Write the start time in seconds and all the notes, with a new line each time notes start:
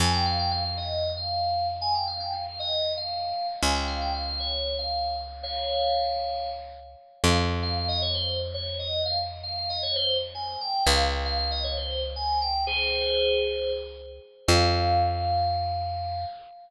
0.00 F2 G#5
0.13 G5
0.25 F5
0.39 G5
0.51 F5
0.65 F5
0.77 D#5
1.17 F5
1.81 G#5
1.94 G5
2.07 F5
2.20 G5
2.32 F5
2.46 F5
2.59 D#5
2.97 F5
3.62 C#2 G#5
3.74 G5
3.87 F5
4.01 G5
4.14 F5
4.27 F5
4.40 C#5
4.78 F5
5.43 C#5 F5
7.24 F2 F5
7.62 F5
7.76 F5
7.88 D#5
8.02 C#5
8.14 C5
8.54 C#5
8.79 D#5
9.05 F5
9.43 F5
9.57 F5
9.69 D#5
9.82 C#5
9.95 C5
10.34 G#5
10.61 G5
10.86 C#2 F5
11.25 F5
11.38 F5
11.51 D#5
11.64 C#5
11.77 C5
12.16 G#5
12.41 G5
12.67 G#4 C5
14.48 F2 F5